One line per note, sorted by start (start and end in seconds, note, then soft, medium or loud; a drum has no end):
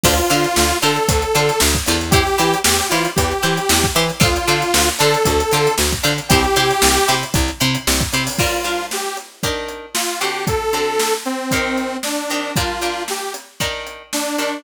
0.03 0.20 D2 loud
0.03 0.14 D4 loud
0.03 0.14 F4 loud
0.03 0.77 F4 loud
0.03 0.14 A4 loud
0.03 0.14 C5 loud
0.03 kick loud
0.03 crash loud
0.18 closed hi-hat medium
0.30 0.46 D3 loud
0.30 0.49 D4 medium
0.30 0.49 F4 loud
0.30 0.49 A4 loud
0.30 0.49 C5 loud
0.30 closed hi-hat medium
0.44 closed hi-hat medium
0.56 0.73 D2 medium
0.56 snare loud
0.71 closed hi-hat medium
0.82 0.99 D3 medium
0.82 1.01 D4 loud
0.82 1.01 F4 loud
0.82 1.01 A4 loud
0.82 1.59 A4 medium
0.82 1.01 C5 loud
0.82 snare medium
0.82 closed hi-hat medium
0.96 closed hi-hat medium
1.08 1.25 D2 medium
1.08 kick loud
1.08 closed hi-hat loud
1.22 closed hi-hat medium
1.35 1.51 D3 medium
1.35 1.54 D4 loud
1.35 1.54 F4 loud
1.35 1.54 A4 loud
1.35 1.54 C5 loud
1.35 closed hi-hat medium
1.49 snare soft
1.49 closed hi-hat medium
1.60 1.77 D2 medium
1.60 snare loud
1.74 kick medium
1.74 closed hi-hat medium
1.86 2.29 E2 loud
1.86 1.98 D4 loud
1.86 1.98 F4 loud
1.86 1.98 A4 loud
1.86 1.98 C5 loud
1.86 closed hi-hat medium
2.01 closed hi-hat medium
2.11 2.23 E4 loud
2.11 2.59 G4 loud
2.11 2.23 G4 loud
2.11 2.23 C5 loud
2.11 kick loud
2.11 closed hi-hat loud
2.27 closed hi-hat medium
2.38 2.55 E3 medium
2.38 2.57 E4 loud
2.38 2.57 G4 loud
2.38 2.57 C5 loud
2.38 snare soft
2.38 closed hi-hat loud
2.53 closed hi-hat medium
2.64 2.81 E2 medium
2.64 2.87 G4 loud
2.64 snare loud
2.79 closed hi-hat medium
2.89 3.07 E3 medium
2.89 3.10 E4 loud
2.89 3.11 F4 medium
2.89 3.10 G4 loud
2.89 3.10 C5 loud
2.89 snare medium
2.89 closed hi-hat loud
3.05 closed hi-hat medium
3.16 3.33 E2 medium
3.16 3.87 G4 loud
3.16 kick loud
3.16 closed hi-hat loud
3.31 closed hi-hat medium
3.42 3.60 E3 medium
3.42 3.61 E4 loud
3.42 3.61 G4 medium
3.42 3.61 C5 loud
3.42 closed hi-hat medium
3.57 closed hi-hat medium
3.69 3.86 E2 loud
3.69 snare loud
3.83 kick loud
3.83 snare soft
3.83 closed hi-hat medium
3.95 4.11 E3 loud
3.95 4.05 E4 loud
3.95 4.05 G4 loud
3.95 4.05 C5 loud
3.95 closed hi-hat medium
4.09 closed hi-hat medium
4.20 4.38 D2 medium
4.20 4.30 D4 loud
4.20 4.30 F4 loud
4.20 4.89 F4 loud
4.20 4.30 A4 loud
4.20 4.30 C5 loud
4.20 kick loud
4.20 closed hi-hat loud
4.36 closed hi-hat medium
4.47 4.63 D3 medium
4.47 4.67 D4 medium
4.47 4.67 F4 loud
4.47 4.67 A4 loud
4.47 4.67 C5 loud
4.47 snare soft
4.47 closed hi-hat medium
4.62 closed hi-hat medium
4.74 4.90 D2 medium
4.74 snare loud
4.88 closed hi-hat medium
4.99 5.16 D3 loud
4.99 5.19 D4 loud
4.99 5.19 F4 loud
4.99 5.75 A4 loud
4.99 5.19 A4 loud
4.99 5.19 C5 loud
4.99 snare medium
4.99 closed hi-hat medium
5.14 closed hi-hat medium
5.25 5.42 D2 medium
5.25 kick loud
5.25 closed hi-hat loud
5.40 snare soft
5.40 closed hi-hat medium
5.51 5.68 D3 loud
5.51 5.72 D4 loud
5.51 5.72 F4 loud
5.51 5.72 A4 loud
5.51 5.72 C5 loud
5.51 snare soft
5.51 closed hi-hat medium
5.67 closed hi-hat medium
5.78 5.94 D2 medium
5.78 snare loud
5.92 kick medium
5.92 closed hi-hat medium
6.03 6.20 D3 loud
6.03 6.13 D4 loud
6.03 6.13 F4 loud
6.03 6.13 A4 loud
6.03 6.13 C5 loud
6.03 snare soft
6.03 closed hi-hat medium
6.18 closed hi-hat medium
6.29 6.46 C2 loud
6.29 6.41 E4 loud
6.29 7.14 G4 loud
6.29 6.41 G4 loud
6.29 6.41 C5 loud
6.29 kick loud
6.29 closed hi-hat loud
6.44 closed hi-hat medium
6.56 6.72 C3 medium
6.56 6.75 E4 loud
6.56 6.75 G4 loud
6.56 6.75 C5 loud
6.56 closed hi-hat loud
6.70 closed hi-hat medium
6.82 6.98 C2 medium
6.82 snare loud
6.96 snare soft
6.96 closed hi-hat medium
7.08 7.24 C3 medium
7.08 7.27 E4 loud
7.08 7.27 G4 loud
7.08 7.27 C5 loud
7.08 snare medium
7.08 closed hi-hat medium
7.23 closed hi-hat medium
7.34 7.51 C2 loud
7.34 kick loud
7.34 closed hi-hat loud
7.48 snare soft
7.48 closed hi-hat medium
7.60 7.77 C3 loud
7.60 7.79 E4 loud
7.60 7.79 G4 loud
7.60 7.79 C5 loud
7.60 closed hi-hat medium
7.75 closed hi-hat medium
7.87 8.03 C2 loud
7.87 snare loud
8.00 kick loud
8.00 closed hi-hat medium
8.12 8.29 C3 medium
8.12 8.23 E4 loud
8.12 8.23 G4 loud
8.12 8.23 C5 loud
8.12 closed hi-hat medium
8.27 open hi-hat medium
8.38 8.61 G3 medium
8.38 8.61 D4 medium
8.38 8.86 F4 medium
8.38 8.61 F4 medium
8.38 8.61 A#4 loud
8.38 kick loud
8.38 crash loud
8.64 9.07 G3 medium
8.64 9.07 D4 medium
8.64 9.07 F4 medium
8.64 9.07 A#4 medium
8.64 snare soft
8.64 closed hi-hat medium
8.79 snare soft
8.91 9.17 G4 medium
8.91 snare loud
9.17 closed hi-hat medium
9.43 9.86 D#3 loud
9.43 9.86 D4 medium
9.43 9.86 G4 medium
9.43 9.86 A#4 medium
9.43 kick medium
9.43 closed hi-hat loud
9.68 closed hi-hat medium
9.94 10.19 F4 medium
9.94 snare loud
10.20 10.68 D3 medium
10.20 10.68 C4 medium
10.20 10.68 F#4 medium
10.20 10.45 G4 medium
10.20 10.68 A4 medium
10.20 closed hi-hat medium
10.47 11.14 A4 medium
10.47 kick loud
10.47 closed hi-hat loud
10.73 11.16 D3 medium
10.73 11.16 C4 medium
10.73 11.16 F#4 medium
10.73 11.16 A4 medium
10.73 closed hi-hat medium
10.99 snare loud
11.25 11.97 C4 medium
11.25 closed hi-hat medium
11.51 11.95 D#3 medium
11.51 11.95 C4 medium
11.51 11.95 G4 medium
11.51 11.95 A#4 medium
11.51 kick medium
11.51 closed hi-hat loud
11.77 snare soft
11.77 closed hi-hat medium
12.03 12.53 D4 medium
12.03 snare loud
12.30 12.52 D#3 medium
12.30 12.52 C4 medium
12.30 12.52 G4 medium
12.30 12.52 A#4 medium
12.30 closed hi-hat medium
12.56 12.78 G3 loud
12.56 12.78 D4 medium
12.56 13.03 F4 medium
12.56 12.78 F4 medium
12.56 12.78 A#4 medium
12.56 kick loud
12.56 closed hi-hat loud
12.81 13.25 G3 medium
12.81 13.25 D4 medium
12.81 13.25 F4 medium
12.81 13.25 A#4 medium
12.81 closed hi-hat medium
12.97 snare soft
13.08 13.33 G4 medium
13.08 snare medium
13.34 closed hi-hat medium
13.60 14.03 D#3 loud
13.60 14.03 D4 medium
13.60 14.03 G4 medium
13.60 14.03 A#4 medium
13.60 kick medium
13.60 closed hi-hat medium
13.87 closed hi-hat medium
14.13 14.37 D4 medium
14.13 snare loud
14.37 14.60 D#3 medium
14.37 14.61 D4 medium
14.37 14.60 D4 medium
14.37 14.60 G4 medium
14.37 14.60 A#4 medium
14.37 closed hi-hat medium